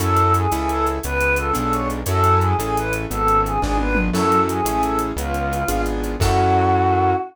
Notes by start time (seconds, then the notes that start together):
0.00 F#2 C#4 E4 F#4 A4, closed hi-hat
0.17 closed hi-hat
0.34 G#4, closed hi-hat
0.52 C#2 C#4 E4 G#4 A4, closed hi-hat
0.69 A4, closed hi-hat
0.86 closed hi-hat
1.03 C#2 B3 B4, closed hi-hat
1.21 C#4, closed hi-hat
1.36 F4 A4, closed hi-hat
1.53 B1 B3 D4 F4 G#4 A4, closed hi-hat
1.72 C#5, closed hi-hat
1.90 closed hi-hat
2.06 F#2 C#4 E4 F#4 A4, closed hi-hat
2.24 closed hi-hat
2.41 G#4, closed hi-hat
2.58 A1 C#4 E4 G#4 A4, closed hi-hat
2.77 B4, closed hi-hat
2.93 closed hi-hat
3.10 G#1 B3 A4, closed hi-hat
3.27 C#4, closed hi-hat
3.45 F4 G#4, closed hi-hat
3.61 G#1 B3 D4 F4 G#4, kick, snare
3.78 B4, high tom
3.95 mid tom
4.13 F#2 C#4 E4 F#4 A4, crash
4.32 closed hi-hat
4.49 G#4, closed hi-hat
4.65 A1 C#4 E4 G#4 A4, closed hi-hat
4.82 A4, closed hi-hat
4.99 closed hi-hat
5.16 C#2 B3 F4, closed hi-hat
5.34 C#4, closed hi-hat
5.52 F4, closed hi-hat
5.68 G#1 B3 D4 F4 G#4, closed hi-hat
5.86 closed hi-hat
6.03 closed hi-hat
6.20 F#2 C#4 E4 F#4 A4, kick, crash